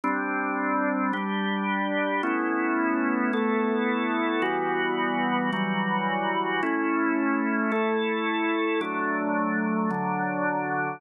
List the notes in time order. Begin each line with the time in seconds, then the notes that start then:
0.04 G3 C4 D4
1.13 G3 D4 G4
2.23 A3 B3 C#4 E4
3.33 A3 B3 E4 A4
4.42 E3 G3 B3 F#4
5.53 E3 F#3 G3 F#4
6.63 A3 C#4 E4
7.72 A3 E4 A4
8.81 F#3 A3 D4
9.91 D3 F#3 D4